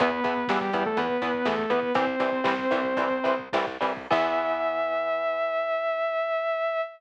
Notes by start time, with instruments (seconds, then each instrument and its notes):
0.00 electric bass (finger) E2, overdriven guitar E3 B3, lead 2 (sawtooth) B3 B4, kick, closed hi-hat
0.11 kick
0.24 electric bass (finger) E2, overdriven guitar E3 B3, kick, closed hi-hat
0.37 kick
0.48 electric bass (finger) E2, overdriven guitar E3 B3, lead 2 (sawtooth) G3 G4, kick, snare
0.61 lead 2 (sawtooth) G3 G4, kick
0.73 electric bass (finger) E2, overdriven guitar E3 B3, kick, closed hi-hat
0.86 lead 2 (sawtooth) A3 A4, kick
0.97 electric bass (finger) E2, overdriven guitar E3 B3, lead 2 (sawtooth) B3 B4, kick, closed hi-hat
1.10 kick
1.22 electric bass (finger) E2, overdriven guitar E3 B3, kick, closed hi-hat
1.34 kick
1.45 electric bass (finger) E2, overdriven guitar E3 B3, lead 2 (sawtooth) A3 A4, kick, snare
1.59 kick
1.70 electric bass (finger) E2, overdriven guitar E3 B3, lead 2 (sawtooth) B3 B4, kick, closed hi-hat
1.83 kick
1.95 electric bass (finger) C2, overdriven guitar E3 G3 C4, lead 2 (sawtooth) C4 C5, kick, closed hi-hat
2.07 kick
2.20 electric bass (finger) C2, overdriven guitar E3 G3 C4, kick, closed hi-hat
2.32 kick
2.44 electric bass (finger) C2, overdriven guitar E3 G3 C4, kick, snare
2.59 kick
2.71 electric bass (finger) C2, overdriven guitar E3 G3 C4, kick, closed hi-hat
2.84 kick
2.97 electric bass (finger) C2, overdriven guitar E3 G3 C4, kick, closed hi-hat
3.11 kick
3.24 electric bass (finger) C2, overdriven guitar E3 G3 C4, kick, closed hi-hat
3.39 kick
3.53 electric bass (finger) C2, overdriven guitar E3 G3 C4, kick, snare
3.67 kick
3.81 electric bass (finger) C2, overdriven guitar E3 G3 C4, kick, open hi-hat
3.97 kick
4.11 electric bass (finger) E2, overdriven guitar E3 B3, lead 2 (sawtooth) E5, kick, crash